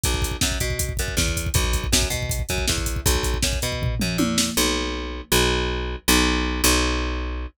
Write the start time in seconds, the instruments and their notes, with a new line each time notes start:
0.04 electric bass (finger) B1, kick, closed hi-hat
0.14 kick
0.22 kick, closed hi-hat
0.31 kick
0.41 electric bass (finger) F#2, kick, snare
0.52 kick
0.60 electric bass (finger) B2, kick, closed hi-hat
0.70 kick
0.79 kick, closed hi-hat
0.89 kick
0.97 electric bass (finger) F#2, kick, closed hi-hat
1.08 kick
1.17 electric bass (finger) E2, kick, snare
1.28 kick
1.37 kick, closed hi-hat
1.46 kick
1.54 electric bass (finger) B1, kick, closed hi-hat
1.64 kick
1.73 kick, closed hi-hat
1.84 kick
1.92 electric bass (finger) F#2, kick, snare
2.02 kick
2.10 electric bass (finger) B2, kick, closed hi-hat
2.22 kick
2.29 kick, closed hi-hat
2.39 kick
2.49 electric bass (finger) F#2, kick, closed hi-hat
2.58 kick
2.68 electric bass (finger) E2, kick, snare
2.78 kick
2.86 kick, closed hi-hat
2.96 kick
3.06 electric bass (finger) B1, kick, closed hi-hat
3.15 kick
3.23 kick, closed hi-hat
3.34 kick
3.43 electric bass (finger) F#2, kick, snare
3.53 kick
3.62 electric bass (finger) B2, kick, closed hi-hat
3.72 kick
3.82 kick, floor tom
4.00 electric bass (finger) F#2, mid tom
4.18 electric bass (finger) E2, high tom
4.38 snare
4.57 electric bass (finger) B1
5.32 electric bass (finger) B1
6.08 electric bass (finger) B1
6.64 electric bass (finger) B1